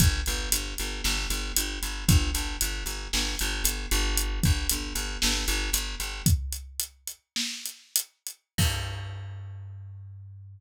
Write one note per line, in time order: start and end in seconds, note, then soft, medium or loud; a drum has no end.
0.00 0.21 G1 loud
0.00 kick loud
0.00 closed hi-hat loud
0.26 0.49 G1 loud
0.26 closed hi-hat medium
0.52 0.74 G1 loud
0.52 closed hi-hat loud
0.78 1.02 G1 medium
0.78 closed hi-hat medium
1.04 1.27 G1 loud
1.04 snare loud
1.30 1.52 G1 loud
1.30 closed hi-hat medium
1.56 1.79 G1 medium
1.56 closed hi-hat loud
1.82 2.05 G1 medium
1.82 closed hi-hat medium
2.08 2.31 G1 loud
2.08 kick loud
2.08 closed hi-hat loud
2.34 2.57 G1 loud
2.34 closed hi-hat medium
2.61 2.84 G1 medium
2.61 closed hi-hat loud
2.86 3.08 G1 medium
2.86 closed hi-hat medium
3.13 3.36 G1 loud
3.13 snare loud
3.39 3.63 G1 loud
3.39 closed hi-hat medium
3.64 3.86 G1 medium
3.64 closed hi-hat loud
3.91 4.40 G1 loud
3.91 closed hi-hat medium
4.17 closed hi-hat loud
4.43 4.67 G1 loud
4.43 kick loud
4.43 closed hi-hat medium
4.69 4.93 G1 medium
4.69 closed hi-hat loud
4.95 5.17 G1 medium
4.95 closed hi-hat medium
5.22 5.45 G1 loud
5.22 snare loud
5.48 5.70 G1 loud
5.48 closed hi-hat medium
5.73 5.95 G1 medium
5.73 closed hi-hat loud
6.00 6.22 G1 medium
6.00 closed hi-hat medium
6.26 kick loud
6.26 closed hi-hat loud
6.53 closed hi-hat medium
6.80 closed hi-hat loud
7.07 closed hi-hat medium
7.36 snare loud
7.66 closed hi-hat medium
7.96 closed hi-hat loud
8.27 closed hi-hat medium
8.58 10.60 G2 loud
8.58 kick loud
8.58 crash loud